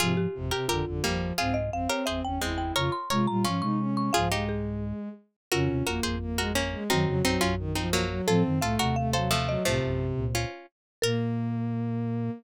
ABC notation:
X:1
M:4/4
L:1/8
Q:1/4=174
K:Fm
V:1 name="Marimba"
F G2 G F4 | f e f d =e g2 g | d' c' d' b d' d'2 d' | f2 A4 z2 |
[K:Bbm] F8 | G8 | =A z f g f f f e | c6 z2 |
B8 |]
V:2 name="Pizzicato Strings"
[FA]3 [GB] [GB] z [G,B,]2 | [FA]3 [GB] [Ac] z [A,C]2 | [Bd]2 [Bd] z [DF]4 | [FA] [EG]3 z4 |
[K:Bbm] [GB]2 [GB] [Ac] z [GB] [B,D]2 | [CE]2 [CE] [DF] z [CE] [G,B,]2 | [F=A]2 [FA] [GB] z [Ac] [F,=A,]2 | [F,=A,]3 z [DF]2 z2 |
B8 |]
V:3 name="Violin"
C, z C, C, =D, D, F,2 | C z C C C D =E2 | F z F F D E D2 | F, A,5 z2 |
[K:Bbm] D2 B,2 B, A, z A, | G, G, G,2 E, F,2 G, | C2 =A,2 A, G, z G, | C,4 z4 |
B,8 |]
V:4 name="Flute" clef=bass
[A,,F,]2 [A,,,F,,] z [A,,,F,,] [A,,,F,,] [A,,,F,,]2 | [C,,A,,]2 [A,,,F,,] z [G,,,=E,,] [G,,,E,,] [G,,,E,,]2 | [F,,D,] z [C,A,] [B,,G,] [A,,F,] [C,A,]3 | [C,,A,,]5 z3 |
[K:Bbm] [F,,D,] [E,,C,] [A,,,F,,] [A,,,F,,]5 | [G,,E,] [F,,D,] [B,,,G,,] [B,,,G,,]5 | [=A,,F,] [G,,E,] [C,,A,,] [E,,C,]5 | [C,,=A,,] [B,,,G,,]2 [D,,B,,]2 z3 |
B,,8 |]